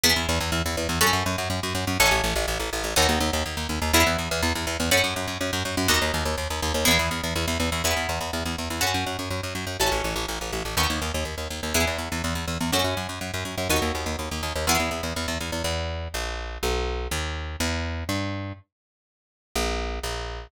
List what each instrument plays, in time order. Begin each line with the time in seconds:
0.04 electric bass (finger) E2, acoustic guitar (steel) B3 E4 G#4
0.16 electric bass (finger) E2
0.29 electric bass (finger) E2
0.40 electric bass (finger) E2
0.52 electric bass (finger) E2
0.66 electric bass (finger) E2
0.77 electric bass (finger) E2
0.89 electric bass (finger) E2
1.01 electric bass (finger) F#2, acoustic guitar (steel) C#4 F#4 A4
1.13 electric bass (finger) F#2
1.26 electric bass (finger) F#2
1.38 electric bass (finger) F#2
1.50 electric bass (finger) F#2
1.63 electric bass (finger) F#2
1.75 electric bass (finger) F#2
1.87 electric bass (finger) F#2
2.00 electric bass (finger) A1, acoustic guitar (steel) C#4 F#4 A4
2.11 electric bass (finger) A1
2.24 electric bass (finger) A1
2.36 electric bass (finger) A1
2.48 electric bass (finger) A1
2.60 electric bass (finger) A1
2.73 electric bass (finger) A1
2.84 electric bass (finger) A1
2.96 electric bass (finger) D#2, acoustic guitar (steel) B3 D#4 F#4
3.09 electric bass (finger) D#2
3.20 electric bass (finger) D#2
3.33 electric bass (finger) D#2
3.46 electric bass (finger) D#2
3.57 electric bass (finger) D#2
3.69 electric bass (finger) D#2
3.82 electric bass (finger) D#2
3.93 electric bass (finger) E2, acoustic guitar (steel) B3 E4 G#4
4.06 electric bass (finger) E2
4.18 electric bass (finger) E2
4.31 electric bass (finger) E2
4.43 electric bass (finger) E2
4.55 electric bass (finger) E2
4.67 electric bass (finger) E2
4.80 electric bass (finger) E2
4.91 electric bass (finger) F#2, acoustic guitar (steel) C#4 F#4 A4
5.04 electric bass (finger) F#2
5.16 electric bass (finger) F#2
5.27 electric bass (finger) F#2
5.41 electric bass (finger) F#2
5.53 electric bass (finger) F#2
5.65 electric bass (finger) F#2
5.77 electric bass (finger) F#2
5.88 electric bass (finger) D#2, acoustic guitar (steel) B3 D#4 F#4
6.02 electric bass (finger) D#2
6.14 electric bass (finger) D#2
6.25 electric bass (finger) D#2
6.38 electric bass (finger) D#2
6.50 electric bass (finger) D#2
6.62 electric bass (finger) D#2
6.74 electric bass (finger) D#2
6.85 electric bass (finger) E2, acoustic guitar (steel) B3 E4 G#4
6.99 electric bass (finger) E2
7.11 electric bass (finger) E2
7.24 electric bass (finger) E2
7.36 electric bass (finger) E2
7.48 electric bass (finger) E2
7.60 electric bass (finger) E2
7.72 electric bass (finger) E2
7.84 electric bass (finger) E2, acoustic guitar (steel) B3 E4 G#4
7.97 electric bass (finger) E2
8.09 electric bass (finger) E2
8.21 electric bass (finger) E2
8.33 electric bass (finger) E2
8.46 electric bass (finger) E2
8.58 electric bass (finger) E2
8.70 electric bass (finger) E2
8.81 electric bass (finger) F#2, acoustic guitar (steel) C#4 F#4 A4
8.94 electric bass (finger) F#2
9.06 electric bass (finger) F#2
9.19 electric bass (finger) F#2
9.30 electric bass (finger) F#2
9.43 electric bass (finger) F#2
9.55 electric bass (finger) F#2
9.67 electric bass (finger) F#2
9.80 electric bass (finger) A1, acoustic guitar (steel) C#4 F#4 A4
9.92 electric bass (finger) A1
10.04 electric bass (finger) A1
10.16 electric bass (finger) A1
10.28 electric bass (finger) A1
10.41 electric bass (finger) A1
10.53 electric bass (finger) A1
10.65 electric bass (finger) A1
10.77 electric bass (finger) D#2, acoustic guitar (steel) B3 D#4 F#4
10.90 electric bass (finger) D#2
11.02 electric bass (finger) D#2
11.14 electric bass (finger) D#2
11.25 electric bass (finger) D#2
11.38 electric bass (finger) D#2
11.50 electric bass (finger) D#2
11.63 electric bass (finger) D#2
11.74 electric bass (finger) E2, acoustic guitar (steel) B3 E4 G#4
11.87 electric bass (finger) E2
11.98 electric bass (finger) E2
12.12 electric bass (finger) E2
12.24 electric bass (finger) E2
12.35 electric bass (finger) E2
12.48 electric bass (finger) E2
12.61 electric bass (finger) E2
12.72 electric bass (finger) F#2, acoustic guitar (steel) C#4 F#4 A4
12.84 electric bass (finger) F#2
12.97 electric bass (finger) F#2
13.09 electric bass (finger) F#2
13.21 electric bass (finger) F#2
13.34 electric bass (finger) F#2
13.45 electric bass (finger) F#2
13.58 electric bass (finger) F#2
13.69 electric bass (finger) D#2, acoustic guitar (steel) B3 D#4 F#4
13.82 electric bass (finger) D#2
13.95 electric bass (finger) D#2
14.06 electric bass (finger) D#2
14.19 electric bass (finger) D#2
14.31 electric bass (finger) D#2
14.43 electric bass (finger) D#2
14.56 electric bass (finger) D#2
14.67 electric bass (finger) E2, acoustic guitar (steel) B3 E4 G#4
14.80 electric bass (finger) E2
14.91 electric bass (finger) E2
15.03 electric bass (finger) E2
15.16 electric bass (finger) E2
15.28 electric bass (finger) E2
15.41 electric bass (finger) E2
15.52 electric bass (finger) E2
15.64 electric bass (finger) E2
16.14 electric bass (finger) A#1
16.63 electric bass (finger) B1
17.11 electric bass (finger) D#2
17.60 electric bass (finger) E2
18.09 electric bass (finger) G2
19.55 electric bass (finger) A#1
20.03 electric bass (finger) A#1